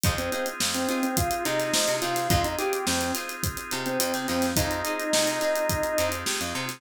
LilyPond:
<<
  \new Staff \with { instrumentName = "Drawbar Organ" } { \time 4/4 \key f \minor \tempo 4 = 106 r16 c'16 c'16 r8 c'16 c'16 c'16 f'8 ees'4 f'8 | f'16 ees'16 g'8 c'8 r4 r16 c'8. c'8 | ees'2. r4 | }
  \new Staff \with { instrumentName = "Acoustic Guitar (steel)" } { \time 4/4 \key f \minor <ees' f' aes' c''>8 <ees' f' aes' c''>4 <ees' f' aes' c''>4 <ees' f' aes' c''>4 <ees' f' aes' c''>8 | <ees' f' aes' c''>8 <ees' f' aes' c''>4 <ees' f' aes' c''>4 <ees' f' aes' c''>4 <ees' f' aes' c''>8 | <ees' f' aes' c''>8 <ees' f' aes' c''>4 <ees' f' aes' c''>4 <ees' f' aes' c''>4 <ees' f' aes' c''>8 | }
  \new Staff \with { instrumentName = "Drawbar Organ" } { \time 4/4 \key f \minor <c' ees' f' aes'>1 | <c' ees' f' aes'>1 | <c' ees' f' aes'>1 | }
  \new Staff \with { instrumentName = "Electric Bass (finger)" } { \clef bass \time 4/4 \key f \minor f,4 f,4. c8 f16 c16 c8 | f,4 f,4. c8 f,16 c16 f,8 | f,4 c4. f,8 c16 f,16 c8 | }
  \new DrumStaff \with { instrumentName = "Drums" } \drummode { \time 4/4 <hh bd>16 hh16 hh16 hh16 sn16 hh16 hh16 hh16 <hh bd>16 hh16 <hh sn>16 <hh sn>16 sn16 <hh sn>16 hh16 <hh sn>16 | <hh bd>16 hh16 hh16 hh16 sn16 hh16 <hh sn>16 hh16 <hh bd>16 hh16 hh16 hh16 hh16 <hh sn>16 <hh sn>16 <hh sn>16 | <hh bd>16 hh16 hh16 hh16 sn16 <hh sn>16 hh16 hh16 <hh bd>16 hh16 hh16 hh16 sn16 hh8 <hh sn>16 | }
>>